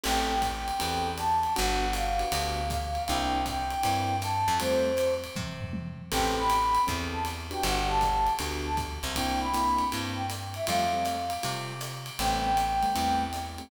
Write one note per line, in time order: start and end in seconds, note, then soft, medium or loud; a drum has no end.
0.03 0.71 A1 medium
0.03 0.34 B3 medium
0.03 0.34 C4 medium
0.03 0.34 G4 medium
0.03 0.34 A4 medium
0.03 0.41 G5 medium
0.03 crash medium
0.03 ride medium
0.41 1.11 G5 medium
0.41 kick soft
0.41 hi-hat pedal medium
0.41 ride medium
0.68 ride medium
0.79 1.47 E2 medium
0.79 1.10 B3 medium
0.79 1.10 C4 medium
0.79 1.10 G4 medium
0.79 1.10 A4 medium
0.79 ride medium
1.17 1.53 A5 medium
1.17 hi-hat pedal medium
1.17 ride medium
1.43 ride medium
1.56 2.24 G1 medium
1.56 1.86 B3 medium
1.56 1.86 D4 medium
1.56 1.86 F#4 medium
1.56 1.86 G4 medium
1.56 1.91 F#5 medium
1.56 ride medium
1.93 2.68 F5 medium
1.93 hi-hat pedal medium
1.93 ride medium
2.19 2.28 B3 medium
2.19 2.28 D4 medium
2.19 2.28 F#4 medium
2.19 2.28 G4 medium
2.19 ride medium
2.32 2.98 D2 medium
2.32 2.62 B3 medium
2.32 2.62 D4 medium
2.32 2.62 F#4 medium
2.32 2.62 G4 medium
2.32 ride medium
2.69 3.03 F5 medium
2.69 kick medium
2.69 hi-hat pedal medium
2.69 ride medium
2.95 ride medium
3.07 3.75 C2 medium
3.07 3.39 A#3 medium
3.07 3.39 C4 medium
3.07 3.39 D4 medium
3.07 3.39 E4 medium
3.07 3.44 G5 medium
3.07 ride medium
3.46 4.16 G5 medium
3.46 kick soft
3.46 hi-hat pedal medium
3.46 ride medium
3.70 ride medium
3.83 4.44 G2 medium
3.83 4.14 A#3 medium
3.83 4.14 C4 medium
3.83 4.14 D4 medium
3.83 4.14 E4 medium
3.83 ride medium
4.22 4.57 A5 medium
4.22 hi-hat pedal medium
4.22 ride medium
4.48 5.26 F2 medium
4.48 ride medium
4.60 4.90 G3 medium
4.60 4.90 A3 medium
4.60 4.90 C4 medium
4.60 4.90 F4 medium
4.60 5.15 C5 medium
4.60 ride medium
4.97 hi-hat pedal medium
4.97 ride medium
5.24 ride medium
5.36 6.02 C3 medium
5.36 kick medium
5.36 high tom medium
5.61 floor tom medium
5.73 high tom medium
6.11 6.78 A1 medium
6.11 6.42 B3 medium
6.11 6.42 C4 medium
6.11 6.42 G4 medium
6.11 6.42 A4 medium
6.11 6.35 G5 medium
6.11 kick medium
6.11 crash medium
6.11 ride medium
6.37 6.82 B5 medium
6.49 hi-hat pedal medium
6.49 ride medium
6.75 ride medium
6.87 7.54 E2 medium
6.87 7.17 B3 medium
6.87 7.17 C4 medium
6.87 7.17 G4 medium
6.87 7.17 A4 medium
6.87 kick medium
6.87 ride medium
7.13 7.23 A5 medium
7.25 hi-hat pedal medium
7.25 ride medium
7.51 7.81 B3 medium
7.51 7.81 D4 medium
7.51 7.81 F#4 medium
7.51 7.81 G4 medium
7.51 7.64 G5 medium
7.51 ride medium
7.63 8.29 G1 medium
7.63 7.88 F#5 medium
7.63 ride medium
7.88 8.11 B3 medium
7.88 8.11 D4 medium
7.88 8.11 F#4 medium
7.88 8.11 G4 medium
7.88 8.34 A5 medium
8.01 kick soft
8.01 hi-hat pedal medium
8.01 ride medium
8.27 ride medium
8.39 8.99 D2 medium
8.39 8.70 B3 medium
8.39 8.70 D4 medium
8.39 8.70 F#4 medium
8.39 8.70 G4 medium
8.39 ride medium
8.65 8.76 A5 medium
8.77 kick medium
8.77 hi-hat pedal medium
8.77 ride medium
9.03 9.82 C2 medium
9.03 ride medium
9.15 9.46 A#3 medium
9.15 9.46 C4 medium
9.15 9.46 D4 medium
9.15 9.46 E4 medium
9.15 9.39 G5 medium
9.15 kick soft
9.15 ride medium
9.41 9.85 B5 medium
9.54 9.84 A#3 medium
9.54 9.84 C4 medium
9.54 9.84 D4 medium
9.54 9.84 E4 medium
9.54 hi-hat pedal medium
9.54 ride medium
9.78 ride medium
9.92 10.59 G2 medium
9.92 10.23 A#3 medium
9.92 10.23 C4 medium
9.92 10.23 D4 medium
9.92 10.23 E4 medium
9.92 ride medium
10.15 10.26 G5 medium
10.30 hi-hat pedal medium
10.30 ride medium
10.54 10.66 E5 medium
10.54 ride medium
10.67 11.34 F2 medium
10.67 10.85 G3 medium
10.67 10.85 A3 medium
10.67 10.85 C4 medium
10.67 10.85 F4 medium
10.67 11.25 F5 medium
10.67 ride medium
10.93 11.16 G3 medium
10.93 11.16 A3 medium
10.93 11.16 C4 medium
10.93 11.16 F4 medium
11.05 hi-hat pedal medium
11.05 ride medium
11.30 ride medium
11.43 12.10 C3 medium
11.43 11.73 G3 medium
11.43 11.73 A3 medium
11.43 11.73 C4 medium
11.43 11.73 F4 medium
11.43 ride medium
11.81 hi-hat pedal medium
11.81 ride medium
12.06 ride medium
12.19 12.85 A1 medium
12.19 12.50 G3 medium
12.19 12.50 A3 medium
12.19 12.50 B3 medium
12.19 12.50 C4 medium
12.19 13.23 G5 medium
12.19 ride medium
12.57 hi-hat pedal medium
12.57 ride medium
12.82 12.91 G3 medium
12.82 12.91 A3 medium
12.82 12.91 B3 medium
12.82 12.91 C4 medium
12.82 ride medium
12.95 13.62 E2 medium
12.95 13.25 G3 medium
12.95 13.25 A3 medium
12.95 13.25 B3 medium
12.95 13.25 C4 medium
12.95 ride medium
13.33 hi-hat pedal medium
13.33 ride medium
13.58 13.67 G3 medium
13.58 13.67 A3 medium
13.58 13.67 B3 medium
13.58 13.67 C4 medium
13.58 ride medium